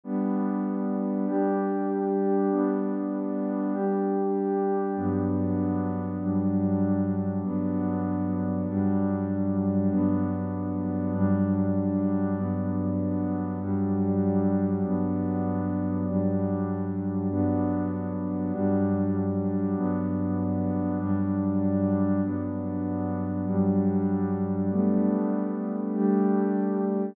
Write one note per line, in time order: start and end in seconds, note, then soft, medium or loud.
0.04 1.26 G3 medium
0.04 1.26 B3 medium
0.04 1.26 D4 medium
1.26 2.48 G3 medium
1.26 2.48 D4 medium
1.26 2.48 G4 medium
2.50 3.72 G3 medium
2.50 3.72 B3 medium
2.50 3.72 D4 medium
3.73 4.95 G3 medium
3.73 4.95 D4 medium
3.73 4.95 G4 medium
4.96 6.18 G2 medium
4.96 6.18 F#3 medium
4.96 6.18 B3 medium
4.96 6.18 D4 medium
6.20 7.42 G2 medium
6.20 7.42 F#3 medium
6.20 7.42 G3 medium
6.20 7.42 D4 medium
7.43 8.65 G2 medium
7.43 8.65 F#3 medium
7.43 8.65 B3 medium
7.43 8.65 D4 medium
8.67 9.89 G2 medium
8.67 9.89 F#3 medium
8.67 9.89 G3 medium
8.67 9.89 D4 medium
9.90 11.12 G2 medium
9.90 11.12 F#3 medium
9.90 11.12 B3 medium
9.90 11.12 D4 medium
11.13 12.35 G2 medium
11.13 12.35 F#3 medium
11.13 12.35 G3 medium
11.13 12.35 D4 medium
12.37 13.59 G2 medium
12.37 13.59 F#3 medium
12.37 13.59 B3 medium
12.37 13.59 D4 medium
13.60 14.82 G2 medium
13.60 14.82 F#3 medium
13.60 14.82 G3 medium
13.60 14.82 D4 medium
14.83 16.05 G2 medium
14.83 16.05 F#3 medium
14.83 16.05 B3 medium
14.83 16.05 D4 medium
16.06 17.28 G2 medium
16.06 17.28 F#3 medium
16.06 17.28 G3 medium
16.06 17.28 D4 medium
17.30 18.51 G2 medium
17.30 18.51 F#3 medium
17.30 18.52 B3 medium
17.30 18.51 D4 medium
18.52 19.74 G2 medium
18.52 19.74 F#3 medium
18.52 19.74 G3 medium
18.52 19.74 D4 medium
19.76 20.98 G2 medium
19.76 20.98 F#3 medium
19.76 20.98 B3 medium
19.76 20.98 D4 medium
20.99 22.21 G2 medium
20.99 22.21 F#3 medium
20.99 22.21 G3 medium
20.99 22.21 D4 medium
22.23 23.45 G2 medium
22.23 23.45 F#3 medium
22.23 23.45 B3 medium
22.23 23.45 D4 medium
23.46 24.68 G2 medium
23.46 24.68 F#3 medium
23.46 24.68 G3 medium
23.46 24.68 D4 medium
24.70 25.92 G3 medium
24.70 25.92 A3 medium
24.70 25.92 B3 medium
24.70 25.92 D4 medium
25.93 27.15 G3 medium
25.93 27.15 A3 medium
25.93 27.15 D4 medium
25.93 27.15 G4 medium